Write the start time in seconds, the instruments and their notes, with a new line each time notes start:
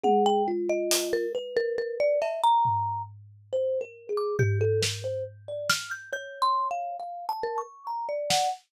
0.04 kalimba G#4, marimba F#5, high tom
0.26 marimba G5
0.48 kalimba F4
0.70 marimba D#5
0.91 closed hi-hat
1.13 marimba A#4
1.35 kalimba B4
1.57 marimba A#4
1.78 marimba A#4
2.00 marimba D5
2.22 marimba E5, cowbell
2.44 marimba A#5
2.65 floor tom
3.53 kalimba C5
3.81 kalimba A#4
4.09 kalimba G#4
4.17 marimba D6
4.39 kalimba G4, marimba G6, floor tom
4.61 kalimba A4
4.82 kalimba A#4, snare
5.04 kalimba C5
5.48 kalimba D5
5.70 marimba F6, snare
5.91 marimba G6
6.13 kalimba C#5, marimba G6
6.42 marimba C6
6.71 marimba F5
7.00 kalimba F5
7.29 kalimba A5
7.43 marimba A#4
7.58 kalimba C#6
7.87 kalimba A#5
8.09 marimba D5
8.30 kalimba F#5, snare